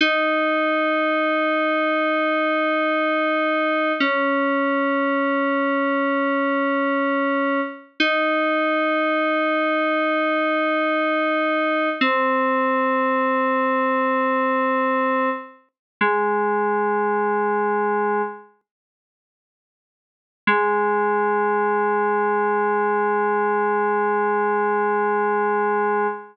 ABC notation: X:1
M:4/4
L:1/8
Q:1/4=60
K:Ab
V:1 name="Electric Piano 2"
E8 | D8 | E8 | C8 |
"^rit." A,5 z3 | A,8 |]